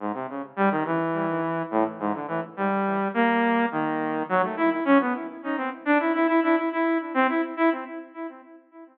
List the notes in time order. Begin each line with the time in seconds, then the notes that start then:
0.00 G#2
0.14 C3
0.29 C#3
0.56 G3
0.71 D#3
0.85 E3
1.71 A2
2.00 G#2
2.14 D3
2.28 E3
2.57 G3
3.14 A#3
3.72 D#3
4.29 F#3
4.43 A3
4.57 E4
4.71 E4
4.85 C#4
5.00 B3
5.44 D#4
5.57 C4
5.85 D4
6.00 E4
6.14 E4
6.27 E4
6.43 E4
6.56 E4
6.72 E4
7.14 C4
7.29 E4
7.57 E4